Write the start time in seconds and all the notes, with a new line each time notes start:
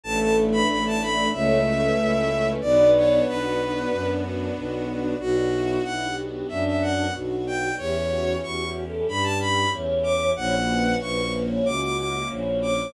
0.03 A1 A3 D4 E4 A4 A5
0.21 A5
0.36 D4
0.51 B4 B5
0.68 A1 E4 B5
0.86 A5
1.01 D4 B5
1.32 C#2 A3 C#4 E4 C#5 E5
1.66 C#4 A4
1.82 B4
1.98 C#2 E4 B4
2.14 A4
2.29 C#4
2.46 B4
2.61 B1 B3 D4 F#4 D5
2.95 D4 C#5
3.26 B1 F#4 B4
3.58 D4
3.91 F#2 B3
4.23 D4
4.55 B1 F#4
4.88 D4
5.20 B1 B3 D4 F#4
5.52 E4
5.84 B1 E4 F#5
6.05 G4
6.26 G4
6.49 F#2 D4 E5
6.67 E5
6.82 F#5
7.14 B1 F#4
7.47 G5
7.78 E2 C#4 E4 G4 C#5
8.10 F#4
8.43 E2 F#4 C#6
8.64 F#4
8.86 A4
9.07 G2 G4 B5
9.23 A5
9.40 B5
9.72 E2 C#5
10.03 D6
10.36 A#1 A#3 C#4 E4 F#4 C#5 F#5
10.69 B4
11.01 A#1 B4 C#6
11.22 B4
11.46 C#5
11.65 C#2 F#4 D6
11.82 D6
11.98 D6
12.29 A#1 C#5
12.62 D6